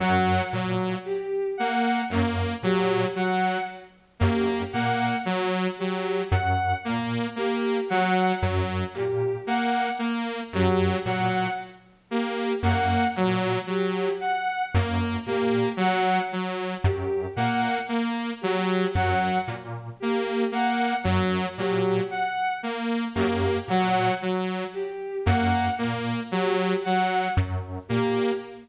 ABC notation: X:1
M:9/8
L:1/8
Q:3/8=38
K:none
V:1 name="Lead 1 (square)" clef=bass
^F,, ^A,, z2 F,, A,, z2 F,, | ^A,, z2 ^F,, A,, z2 F,, A,, | z2 ^F,, ^A,, z2 F,, A,, z | z ^F,, ^A,, z2 F,, A,, z2 |
^F,, ^A,, z2 F,, A,, z2 F,, | ^A,, z2 ^F,, A,, z2 F,, A,, |]
V:2 name="Lead 2 (sawtooth)"
^F, F, z ^A, A, F, F, z A, | ^A, ^F, F, z A, A, F, F, z | ^A, A, ^F, F, z A, A, F, F, | z ^A, A, ^F, F, z A, A, F, |
^F, z ^A, A, F, F, z A, A, | ^F, F, z ^A, A, F, F, z A, |]
V:3 name="Violin"
^f z G f z G f z G | ^f z G f z G f z G | ^f z G f z G f z G | ^f z G f z G f z G |
^f z G f z G f z G | ^f z G f z G f z G |]